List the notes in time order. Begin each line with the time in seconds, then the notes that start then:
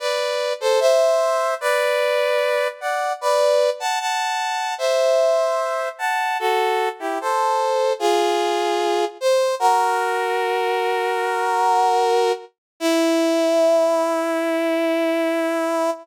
0.00 B4 D5
0.61 A4 C5
0.80 C5 E5
1.61 B4 D5
2.81 D5 F#5
3.21 B4 D5
3.80 F#5 A5
4.00 F#5 A5
4.78 C5 E5
5.99 F#5 A5
6.40 F#4 A4
7.00 E4 G4
7.21 A4 C5
7.99 F4 G#4
9.21 C5
9.60 F#4 A#4
12.80 E4